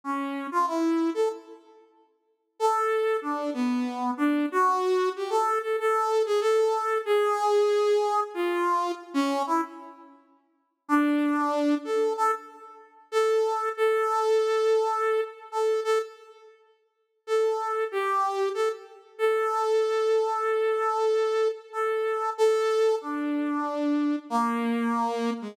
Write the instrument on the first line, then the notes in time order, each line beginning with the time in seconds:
brass section
0.04 C#4
0.51 F4
0.67 E4
1.14 A4
2.59 A4
3.22 D4
3.54 B3
4.17 D4
4.52 F#4
5.16 G4
5.30 A4
5.62 A4
5.79 A4
6.26 G#4
6.41 A4
7.05 G#4
8.34 F4
9.14 C#4
9.47 E4
10.88 D4
11.84 A4
12.17 A4
13.12 A4
13.77 A4
15.52 A4
15.84 A4
17.27 A4
17.92 G4
18.54 A4
19.18 A4
21.73 A4
22.38 A4
23.01 D4
24.30 A#3
25.41 G#3